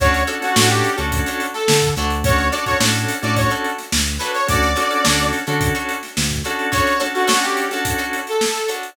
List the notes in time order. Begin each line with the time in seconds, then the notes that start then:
0.00 D2 C#4 D4 F#4 A4 C#5, kick, closed hi-hat
0.14 closed hi-hat
0.27 C#4 D4 F#4 A4 C#5, closed hi-hat
0.41 C#4 D4 F#4 A4, snare, closed hi-hat
0.56 A2 C#4 D4 F#4 A4 C#5, snare
0.69 G4, closed hi-hat
0.84 closed hi-hat
0.97 D2 C#4 D4 F#4 A4 C#5, closed hi-hat
1.12 kick, closed hi-hat
1.26 D4 F#4 A4 C#5, closed hi-hat
1.40 closed hi-hat
1.53 A4, snare, closed hi-hat
1.68 D3, snare
1.82 kick, closed hi-hat
1.96 D2 D4 F#4 A4 C#5, closed hi-hat
2.10 closed hi-hat
2.24 C#4 D4 F#4 A4 C#5, kick, closed hi-hat
2.38 closed hi-hat
2.52 C#4 D4 F#4 A4 C#5 D5, closed hi-hat
2.66 C#4 D4 F#4 A4 C#5, kick, closed hi-hat
2.80 A2 C#4 D4 F#4 A4 C#5, snare
2.94 closed hi-hat
3.09 closed hi-hat
3.22 A2 C#4 D4 F#4 A4 C#5 D5, closed hi-hat
3.36 C#5, kick, closed hi-hat
3.50 D4 F#4 A4 C#5, closed hi-hat
3.64 closed hi-hat
3.78 snare, closed hi-hat
3.92 D2, snare
4.07 closed hi-hat
4.19 D4 F#4 A4 B4 C#5, closed hi-hat
4.34 C#5, closed hi-hat
4.47 D2 C#4 D4 F#4 A4 D5, kick, closed hi-hat
4.63 snare, closed hi-hat
4.76 C#4 D4 F#4 A4 C#5, snare, closed hi-hat
4.90 C#4 D4 F#4 A4, closed hi-hat
5.05 D2 C#4 D4 F#4 A4 C#5, snare
5.19 closed hi-hat
5.33 snare, closed hi-hat
5.47 D3 C#4 D4 F#4 A4 C#5, closed hi-hat
5.61 kick, closed hi-hat
5.75 D4 F#4 A4 C#5, closed hi-hat
5.89 closed hi-hat
6.03 snare, closed hi-hat
6.17 D2, snare
6.31 kick, closed hi-hat
6.44 C#4 D4 F#4 A4 C#5, closed hi-hat
6.59 closed hi-hat
6.72 D4 F#4 A4 C#5, kick, closed hi-hat
6.87 closed hi-hat
7.00 C#4 D4 F#4 A4 C#5, snare, closed hi-hat
7.14 C#4 D4 F#4 A4, closed hi-hat
7.27 C#4 D4 F#4 A4 C#5, snare
7.42 G4, snare, closed hi-hat
7.57 closed hi-hat
7.71 C#4 D4 F#4 A4 C#5, snare, closed hi-hat
7.85 kick, closed hi-hat
7.98 D4 F#4 A4 C#5, closed hi-hat
8.13 closed hi-hat
8.27 A4, closed hi-hat
8.41 snare
8.55 snare, closed hi-hat
8.68 D4 F#4 A4 C#5, closed hi-hat
8.83 closed hi-hat